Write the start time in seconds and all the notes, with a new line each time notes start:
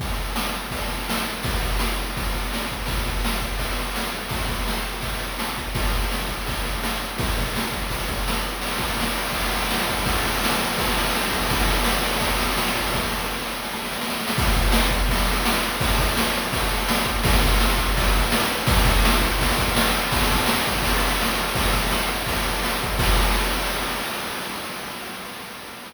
0.00 kick, ride
0.36 snare
0.71 kick, ride
1.10 snare
1.43 kick, ride
1.62 kick
1.79 snare
2.17 kick, ride
2.53 snare
2.71 kick
2.86 kick, ride
3.06 kick
3.25 snare
3.41 kick
3.59 kick, ride
3.96 snare
4.29 kick, ride
4.49 kick
4.67 snare
5.01 kick, ride
5.39 snare
5.58 kick
5.75 kick, ride
5.94 kick
6.11 snare
6.28 kick
6.46 kick, ride
6.65 kick
6.84 snare
7.18 kick, ride
7.38 kick
7.56 snare
7.72 kick
7.90 kick, ride
8.08 kick
8.28 snare
8.61 crash
8.70 ride
8.79 kick, ride
8.88 ride
9.00 snare
9.07 ride
9.15 ride
9.25 ride
9.32 kick, ride
9.43 ride
9.51 ride
9.60 ride
9.71 snare
9.80 ride
9.88 kick, ride
9.97 ride
10.06 kick, ride
10.13 ride
10.24 ride
10.33 ride
10.44 snare
10.49 ride
10.58 ride
10.68 ride
10.78 kick, ride
10.87 ride
10.98 ride
11.05 ride
11.15 snare
11.21 ride
11.30 kick, ride
11.43 ride
11.50 kick, ride
11.60 ride
11.68 ride
11.77 ride
11.84 snare
11.96 ride
12.03 ride
12.11 ride
12.20 kick, ride
12.30 ride
12.38 ride
12.49 ride
12.58 snare
12.66 ride
12.75 kick, ride
12.84 ride
12.94 kick, snare
13.09 snare
13.30 snare
13.46 snare
13.64 snare
13.73 snare
13.85 snare
13.92 snare
14.01 snare
14.10 snare
14.20 snare
14.28 snare
14.38 kick, ride
14.56 kick
14.72 snare
14.91 kick
15.09 kick, ride
15.45 snare
15.81 kick, ride
15.99 kick
16.17 snare
16.53 kick, ride
16.89 snare
17.06 kick
17.24 kick, ride
17.43 kick
17.60 snare
17.78 kick
17.97 kick, ride
18.16 kick
18.32 snare
18.67 kick, ride
18.85 kick
19.05 snare
19.21 kick
19.41 kick, ride
19.58 kick
19.76 snare
20.12 kick, crash
20.31 kick
20.46 snare
20.67 kick
20.82 kick, ride
21.21 snare
21.55 kick, ride
21.74 kick
21.91 snare
22.26 kick, ride
22.63 snare
22.83 kick
22.99 kick, crash